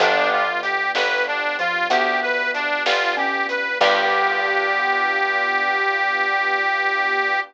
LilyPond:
<<
  \new Staff \with { instrumentName = "Harmonica" } { \time 12/8 \key g \major \tempo 4. = 63 d'8 f'8 g'8 b'8 d'8 f'8 g'8 b'8 d'8 f'8 g'8 b'8 | g'1. | }
  \new Staff \with { instrumentName = "Xylophone" } { \time 12/8 \key g \major f2~ f8 f8 b2 cis'4 | g1. | }
  \new Staff \with { instrumentName = "Acoustic Grand Piano" } { \time 12/8 \key g \major <b d' f' g'>1. | <b d' f' g'>1. | }
  \new Staff \with { instrumentName = "Electric Bass (finger)" } { \clef bass \time 12/8 \key g \major g,,4. g,,4. d,4. g,,4. | g,1. | }
  \new Staff \with { instrumentName = "String Ensemble 1" } { \time 12/8 \key g \major <b d' f' g'>1. | <b d' f' g'>1. | }
  \new DrumStaff \with { instrumentName = "Drums" } \drummode { \time 12/8 <hh bd>4 hh8 sn4 hh8 <hh bd>4 hh8 sn4 hh8 | <cymc bd>4. r4. r4. r4. | }
>>